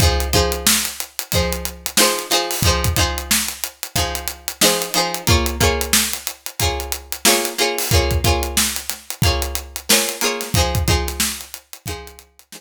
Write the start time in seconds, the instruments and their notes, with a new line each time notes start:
0.00 pizzicato strings F3 D#4 G#4 C5, kick, closed hi-hat
0.20 closed hi-hat
0.33 pizzicato strings F3 D#4 G#4 C5, kick, closed hi-hat
0.52 closed hi-hat
0.67 snare
0.85 closed hi-hat
1.00 closed hi-hat
1.19 closed hi-hat
1.32 pizzicato strings F3 D#4 G#4 C5, kick, closed hi-hat
1.52 closed hi-hat
1.65 closed hi-hat
1.86 closed hi-hat
1.97 pizzicato strings F3 D#4 G#4 C5, snare
2.19 closed hi-hat
2.30 pizzicato strings F3 D#4 G#4 C5, snare, closed hi-hat
2.51 open hi-hat
2.62 pizzicato strings F3 D#4 G#4, kick, closed hi-hat
2.67 pizzicato strings C5
2.84 kick, closed hi-hat
2.96 pizzicato strings F3 D#4 G#4 C5, kick, closed hi-hat
3.18 closed hi-hat
3.31 snare
3.48 closed hi-hat
3.64 closed hi-hat
3.83 closed hi-hat
3.96 pizzicato strings F3 D#4 G#4 C5, kick, closed hi-hat
4.15 closed hi-hat
4.28 closed hi-hat
4.48 closed hi-hat
4.61 pizzicato strings F3 D#4 G#4 C5, snare
4.82 closed hi-hat
4.94 pizzicato strings F3 D#4 G#4 C5, closed hi-hat
5.14 closed hi-hat
5.27 pizzicato strings A#3 F4 G#4 C#5, kick, closed hi-hat
5.46 closed hi-hat
5.60 pizzicato strings A#3 F4 G#4 C#5, kick, closed hi-hat
5.81 closed hi-hat
5.93 snare
6.13 closed hi-hat
6.27 closed hi-hat
6.46 closed hi-hat
6.59 pizzicato strings A#3 F4 G#4 C#5, kick, closed hi-hat
6.80 closed hi-hat
6.92 closed hi-hat
7.12 closed hi-hat
7.25 pizzicato strings A#3 F4 G#4 C#5, snare
7.45 closed hi-hat
7.58 pizzicato strings A#3 F4 G#4 C#5, closed hi-hat
7.78 open hi-hat
7.91 pizzicato strings A#3 F4 G#4 C#5, kick, closed hi-hat
8.11 kick, closed hi-hat
8.24 pizzicato strings A#3 F4 G#4 C#5, kick, closed hi-hat
8.43 closed hi-hat
8.57 snare
8.76 closed hi-hat
8.90 snare, closed hi-hat
9.10 closed hi-hat
9.22 pizzicato strings A#3 F4 G#4, kick, closed hi-hat
9.26 pizzicato strings C#5
9.42 closed hi-hat
9.55 closed hi-hat
9.76 closed hi-hat
9.89 pizzicato strings A#3 F4 G#4 C#5, snare
10.09 closed hi-hat
10.21 pizzicato strings A#3 F4 G#4 C#5, closed hi-hat
10.41 snare, closed hi-hat
10.54 pizzicato strings F3 D#4 G#4, kick, closed hi-hat
10.58 pizzicato strings C5
10.75 kick, closed hi-hat
10.88 pizzicato strings F3 D#4 G#4 C5, kick, closed hi-hat
11.08 snare, closed hi-hat
11.20 snare
11.41 closed hi-hat
11.54 closed hi-hat
11.73 closed hi-hat
11.86 pizzicato strings F3 D#4 G#4, kick, closed hi-hat
11.90 pizzicato strings C5
12.07 closed hi-hat
12.19 closed hi-hat
12.39 closed hi-hat
12.52 pizzicato strings F3 D#4 G#4 C5, snare